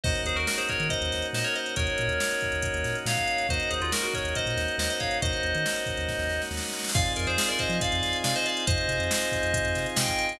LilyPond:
<<
  \new Staff \with { instrumentName = "Electric Piano 2" } { \time 4/4 \key ees \dorian \tempo 4 = 139 <c'' ees''>8 <aes' c''>16 <ges' bes'>16 <ges' bes'>16 <aes' c''>16 <bes' des''>8 <c'' ees''>4 <c'' ees''>16 <bes' des''>16 <c'' ees''>8 | <bes' des''>2. <des'' f''>4 | <c'' ees''>8 <aes' c''>16 <f' aes'>16 <ges' bes'>16 <ges' bes'>16 <bes' des''>8 <c'' ees''>4 <c'' ees''>16 <c'' ees''>16 <des'' f''>8 | <c'' ees''>2. r4 |
\key f \dorian <d'' f''>8 <bes' d''>16 <aes' c''>16 <aes' c''>16 <bes' d''>16 <c'' ees''>8 <d'' f''>4 <d'' f''>16 <c'' ees''>16 <d'' f''>8 | <c'' ees''>2. <ees'' g''>4 | }
  \new Staff \with { instrumentName = "Synth Bass 2" } { \clef bass \time 4/4 \key ees \dorian ees,8 ees,16 ees,4 ees8 ees,16 ees,8 bes,4 | ees,8 bes,16 ees,4 ees,8 ees,16 bes,8 bes,4 | ees,8 ees,16 ees,4 ees,8 bes,16 ees,8 ees,4 | ees,8 ees,16 ees4 ees,8 ees,16 ees,8 ees,4 |
\key f \dorian f,8 f,16 f,4 f8 f,16 f,8 c4 | f,8 c16 f,4 f,8 f,16 c8 c4 | }
  \new Staff \with { instrumentName = "Drawbar Organ" } { \time 4/4 \key ees \dorian <bes des' ees' ges'>1 | <bes des' ees' ges'>1 | <bes des' ees' ges'>1 | <bes des' ees' ges'>1 |
\key f \dorian <c' ees' f' aes'>1 | <c' ees' f' aes'>1 | }
  \new DrumStaff \with { instrumentName = "Drums" } \drummode { \time 4/4 <cymc bd>16 hh16 hh16 hh16 sn16 hh16 <hh bd>16 hh16 <hh bd>16 hh16 <hh sn>16 hh16 sn16 hh16 hh16 hh16 | <hh bd>16 hh16 hh16 hh16 sn16 hh16 <hh bd>16 hh16 <hh bd>16 hh16 <hh sn>16 hh16 sn16 <hh bd>16 hh16 <hh sn>16 | <hh bd>16 hh16 hh16 hh16 sn16 hh16 <hh bd>16 hh16 <hh bd>16 <hh sn>16 <hh sn>16 hh16 sn16 hh16 <hh bd>16 hh16 | <hh bd>16 hh16 hh16 hh16 sn16 hh16 <hh bd>16 <hh sn>16 <bd sn>16 sn16 sn16 sn16 sn32 sn32 sn32 sn32 sn32 sn32 sn32 sn32 |
<cymc bd>16 hh16 hh16 hh16 sn16 hh16 <hh bd>16 hh16 <hh bd>16 hh16 <hh sn>16 hh16 sn16 hh16 hh16 hh16 | <hh bd>16 hh16 hh16 hh16 sn16 hh16 <hh bd>16 hh16 <hh bd>16 hh16 <hh sn>16 hh16 sn16 <hh bd>16 hh16 <hh sn>16 | }
>>